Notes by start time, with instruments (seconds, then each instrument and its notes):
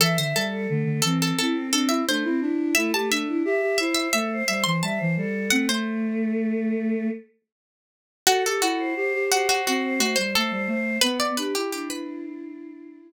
0.00 flute E3, pizzicato strings A4, choir aahs E5
0.17 flute D3, pizzicato strings C5, choir aahs E5
0.35 flute G3, pizzicato strings A4
0.51 choir aahs A4
0.68 flute D3, choir aahs A3
0.84 flute D3
1.02 flute E3, choir aahs C4, pizzicato strings A4
1.22 pizzicato strings A4
1.39 flute C4, choir aahs E4, pizzicato strings A4
1.53 choir aahs C4
1.72 choir aahs C4, flute D4, pizzicato strings A4
1.89 flute E4, pizzicato strings E5
2.07 choir aahs A3, flute D4, pizzicato strings C5
2.24 choir aahs C4, flute E4
2.41 flute D4, choir aahs E4
2.75 choir aahs A3, flute E4, pizzicato strings E5
2.93 choir aahs A3, flute G4, pizzicato strings A5
3.10 flute D4, pizzicato strings E5
3.28 choir aahs E4
3.45 flute G4, choir aahs E5
3.62 flute G4
3.78 flute E4, choir aahs C5, pizzicato strings E5
3.95 pizzicato strings E5
4.13 flute A3, choir aahs A4, pizzicato strings E5
4.33 choir aahs C5
4.47 flute G3, choir aahs C5, pizzicato strings E5
4.64 flute E3, pizzicato strings C6
4.82 flute G3, choir aahs E5, pizzicato strings A5
4.98 flute E3, choir aahs C5
5.17 flute G3, choir aahs A4
5.50 choir aahs A3, flute C4, pizzicato strings F#5
5.68 flute A3, choir aahs A3, pizzicato strings C5
8.27 pizzicato strings F#4, flute F#4, choir aahs A4
8.46 flute G4, pizzicato strings A4, choir aahs A4
8.62 flute E4, pizzicato strings F#4
8.79 choir aahs C5
8.95 flute G4, choir aahs C5
9.14 flute G4
9.31 pizzicato strings F#4, flute G4, choir aahs C5
9.49 pizzicato strings F#4
9.66 flute C4, pizzicato strings F#4, choir aahs C5
9.84 choir aahs C5
9.99 flute A3, pizzicato strings F#4, choir aahs C5
10.16 flute G3, pizzicato strings C5
10.34 flute A3, pizzicato strings A4, choir aahs C5
10.51 flute G3, choir aahs C5
10.67 flute A3, choir aahs C5
11.01 flute B3, choir aahs B3, pizzicato strings B4
11.20 pizzicato strings D5
11.37 flute D4, choir aahs G4, pizzicato strings B4
11.55 flute E4, pizzicato strings G4
11.71 choir aahs D4, pizzicato strings G4
11.90 pizzicato strings B4